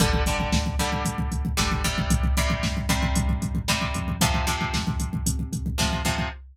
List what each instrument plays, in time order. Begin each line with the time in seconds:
0.00 synth bass 1 G1, acoustic guitar (steel) D3 G3, kick, closed hi-hat
0.13 kick
0.26 acoustic guitar (steel) D3 G3, kick, closed hi-hat
0.40 kick
0.52 synth bass 1 D2, kick, snare
0.66 kick
0.79 acoustic guitar (steel) D3 G3, kick, closed hi-hat
0.92 kick
1.05 synth bass 1 D2, kick, closed hi-hat
1.18 kick
1.32 kick, closed hi-hat
1.45 kick
1.57 synth bass 1 G1, acoustic guitar (steel) D3 G3, kick, snare
1.71 kick
1.84 acoustic guitar (steel) C3 G3, kick, closed hi-hat
1.98 kick
2.10 synth bass 1 C2, kick, closed hi-hat
2.23 kick
2.37 acoustic guitar (steel) C3 G3, kick, closed hi-hat
2.50 kick
2.63 synth bass 1 G2, kick, snare
2.77 kick
2.89 acoustic guitar (steel) C3 G3, kick, closed hi-hat
3.03 kick
3.15 synth bass 1 G2, kick, closed hi-hat
3.29 kick
3.42 kick, closed hi-hat
3.55 kick
3.67 synth bass 1 C2, acoustic guitar (steel) C3 G3, kick, snare
3.81 kick
3.94 synth bass 1 F2, kick, closed hi-hat
4.08 kick
4.21 acoustic guitar (steel) C3 F3, kick, closed hi-hat
4.34 kick
4.47 acoustic guitar (steel) C3 F3, kick, closed hi-hat
4.61 kick
4.74 synth bass 1 F2, kick, snare
4.87 kick
5.00 kick, closed hi-hat
5.13 kick
5.26 synth bass 1 C3, kick, closed hi-hat
5.39 kick
5.53 kick, closed hi-hat
5.66 kick
5.78 synth bass 1 F2, acoustic guitar (steel) C3 F3, kick, snare
5.93 kick
6.05 acoustic guitar (steel) C3 F3, kick, closed hi-hat
6.18 kick